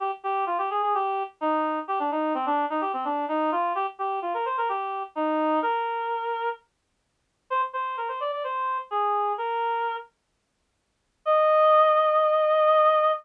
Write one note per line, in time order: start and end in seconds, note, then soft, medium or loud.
0.00 0.11 G4 medium
0.23 0.45 G4 medium
0.46 0.58 F4 medium
0.58 0.69 G4 medium
0.70 0.82 G#4 medium
0.82 0.94 G#4 medium
0.94 1.23 G4 medium
1.41 1.79 D#4 medium
1.88 1.99 G4 medium
1.99 2.10 D4 medium
2.11 2.33 D#4 medium
2.34 2.45 C4 medium
2.46 2.65 D4 medium
2.70 2.81 D#4 medium
2.81 2.92 G4 medium
2.93 3.04 C4 medium
3.05 3.25 D4 medium
3.28 3.50 D#4 medium
3.52 3.73 F4 medium
3.75 3.86 G4 medium
3.99 4.19 G4 medium
4.22 4.33 F4 medium
4.34 4.45 A#4 medium
4.45 4.56 C5 medium
4.58 4.69 A#4 medium
4.69 5.03 G4 medium
5.15 5.59 D#4 medium
5.62 6.49 A#4 medium
7.50 7.61 C5 medium
7.73 7.96 C5 medium
7.97 8.08 A#4 medium
8.08 8.19 C5 medium
8.20 8.31 D5 medium
8.32 8.43 D5 medium
8.44 8.78 C5 medium
8.91 9.33 G#4 medium
9.38 9.96 A#4 medium
11.25 13.11 D#5 loud